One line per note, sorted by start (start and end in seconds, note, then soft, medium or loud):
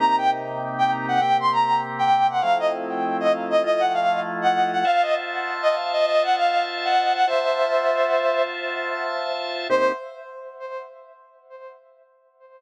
0.00 1.20 C3 loud
0.00 1.20 A#3 loud
0.00 1.20 D#4 loud
0.00 1.20 G4 medium
0.00 0.16 A#5 loud
0.18 0.30 G5 loud
0.78 0.91 G5 medium
1.08 1.20 F#5 medium
1.21 2.41 C3 medium
1.21 2.41 A#3 medium
1.21 2.41 C4 medium
1.21 2.41 G4 medium
1.21 1.37 G5 medium
1.40 1.52 C6 medium
1.52 1.80 A#5 loud
1.99 2.27 G5 loud
2.30 2.42 F#5 medium
2.41 3.63 F3 medium
2.41 3.63 A3 loud
2.41 3.63 C4 loud
2.41 3.63 E4 medium
2.41 2.58 F5 loud
2.59 2.72 D#5 medium
3.20 3.32 D#5 medium
3.50 3.62 D#5 medium
3.64 4.84 F3 medium
3.64 4.84 A3 medium
3.64 4.84 E4 medium
3.64 4.84 F4 medium
3.64 3.81 D#5 loud
3.80 3.92 F#5 loud
3.94 4.19 F5 medium
4.42 4.69 F#5 medium
4.73 4.85 F#5 medium
4.85 7.25 F4 medium
4.85 7.25 C5 medium
4.85 7.25 E5 medium
4.85 5.02 F5 loud
4.85 7.25 A5 loud
5.02 5.14 D#5 medium
5.62 5.74 D#5 medium
5.93 6.05 D#5 medium
6.06 6.23 D#5 loud
6.23 6.36 F#5 loud
6.36 6.64 F5 medium
6.85 7.13 F#5 medium
7.15 7.27 F#5 loud
7.27 9.68 F4 loud
7.27 9.68 C5 medium
7.27 8.43 C5 medium
7.27 9.68 E5 medium
7.27 8.43 E5 loud
7.27 9.68 A5 medium
9.70 9.92 C3 loud
9.70 9.92 A#3 loud
9.70 9.92 D#4 loud
9.70 9.92 G4 loud
9.70 9.92 C5 loud